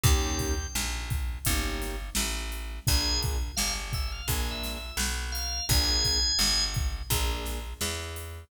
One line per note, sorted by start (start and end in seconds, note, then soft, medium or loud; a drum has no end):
0.03 0.67 D#2 loud
0.03 0.54 A#3 loud
0.03 0.54 C#4 loud
0.03 0.54 D#4 loud
0.03 0.54 G4 loud
0.03 0.67 G5 loud
0.03 kick loud
0.03 closed hi-hat loud
0.39 kick medium
0.39 closed hi-hat medium
0.75 1.39 A#1 medium
0.75 snare loud
1.10 kick medium
1.10 closed hi-hat medium
1.45 2.10 G1 loud
1.45 1.95 A#3 medium
1.45 1.95 C#4 loud
1.45 1.95 D#4 loud
1.45 1.95 G4 loud
1.45 kick medium
1.45 closed hi-hat loud
1.82 snare medium
1.82 closed hi-hat medium
2.15 2.80 A1 medium
2.15 snare loud
2.52 closed hi-hat medium
2.87 3.52 A#1 medium
2.87 3.37 A#3 loud
2.87 3.37 D4 loud
2.87 3.37 F4 loud
2.87 3.37 G#4 loud
2.87 3.20 G#5 loud
2.87 kick loud
2.87 closed hi-hat loud
3.23 kick medium
3.23 closed hi-hat medium
3.56 4.22 G1 medium
3.56 3.73 F5 loud
3.56 snare loud
3.93 4.11 E5 loud
3.93 kick medium
3.93 closed hi-hat medium
4.12 4.29 F5 loud
4.28 4.91 A#1 medium
4.28 4.78 A#3 loud
4.28 4.78 D4 medium
4.28 4.78 F4 medium
4.28 4.78 G#4 loud
4.28 4.50 G#5 medium
4.28 kick medium
4.28 closed hi-hat loud
4.51 4.73 E5 loud
4.63 snare medium
4.63 closed hi-hat medium
4.75 4.97 E5 medium
4.97 5.61 B1 medium
4.97 snare loud
5.32 5.65 F5 medium
5.32 closed hi-hat medium
5.69 6.32 A#1 loud
5.69 6.19 A#3 loud
5.69 6.19 D4 loud
5.69 6.19 F4 loud
5.69 6.19 G#4 loud
5.69 6.64 G#5 loud
5.69 kick loud
5.69 closed hi-hat loud
6.05 kick medium
6.05 closed hi-hat medium
6.39 7.02 G1 medium
6.39 snare loud
6.74 kick loud
6.74 closed hi-hat medium
7.10 7.74 A#1 loud
7.10 7.59 A#3 loud
7.10 7.59 D4 loud
7.10 7.59 F4 medium
7.10 7.59 G#4 medium
7.10 kick medium
7.10 closed hi-hat loud
7.45 snare medium
7.45 closed hi-hat medium
7.81 8.45 E2 medium
7.81 snare loud
8.16 closed hi-hat medium